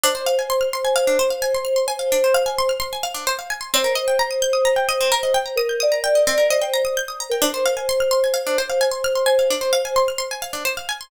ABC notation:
X:1
M:4/4
L:1/16
Q:1/4=130
K:Cm
V:1 name="Electric Piano 2"
c16 | c8 z8 | c16 | B2 d4 d2 c c2 z4 B |
c16 | c8 z8 |]
V:2 name="Pizzicato Strings"
D c f a c' f' c' a f D c f a c' f' c' | a f D c f a c' f' c' a f D c f a c' | C B e g b e' g' e' b g e C B e g b | e' g' e' b g e C B e g b e' g' e' b g |
D c f a c' f' c' a f D c f a c' f' c' | a f D c f a c' f' c' a f D c f a c' |]